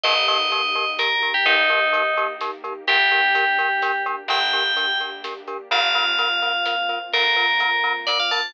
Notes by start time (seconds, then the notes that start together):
0.03 G1 A#3 D#4 G4 A#4 D#5, kick, closed hi-hat
0.28 D#4 G4 A#4 D#5, closed hi-hat
0.52 D#4 G4 A#4, closed hi-hat
0.75 D#4 G4 A#4, closed hi-hat
0.99 D#4 G4 A#4, snare
1.22 D#4 G4 A#4, closed hi-hat
1.34 G4
1.46 G1 D#4 G4 A#4, kick, closed hi-hat
1.70 D#4 G4 A#4, closed hi-hat
1.93 D#4 G4 A#4, closed hi-hat
2.17 D#4 G4 A#4, closed hi-hat
2.41 D#4 G4 A#4, snare
2.64 D#4 G4 A#4, closed hi-hat
2.87 G1 A#3 D4 G4 A#4, kick, closed hi-hat
3.11 D4 G4 A#4, closed hi-hat
3.35 D4 G4 A#4, closed hi-hat
3.58 D4 G4 A#4, closed hi-hat
3.82 D4 G4 A#4, snare
4.06 D4 G4 A#4, closed hi-hat
4.28 G1 D4 G4 A#4 G5, kick, closed hi-hat
4.53 D4 G4 A#4, closed hi-hat
4.77 D4 G4 A#4, closed hi-hat
5.00 D4 G4 A#4, closed hi-hat
5.24 D4 G4 A#4, snare
5.48 D4 G4 A#4, closed hi-hat
5.71 G1 A#3 C4 F4 A#4 F5, kick, closed hi-hat
5.94 C4 F4 A#4, closed hi-hat
6.19 C4 F4 A#4, closed hi-hat
6.42 C4 F4 A#4, closed hi-hat
6.65 C4 F4 A#4, snare
6.89 C4 F4 A#4, closed hi-hat
7.13 G1 C4 F4 A#4, kick, closed hi-hat
7.36 C4 F4 A#4, closed hi-hat
7.60 C4 F4 A#4, closed hi-hat
7.84 C4 F4 A#4, closed hi-hat
8.07 C4 F4 A#4 D5, snare
8.20 F5
8.31 C4 F4 A#4 A5, closed hi-hat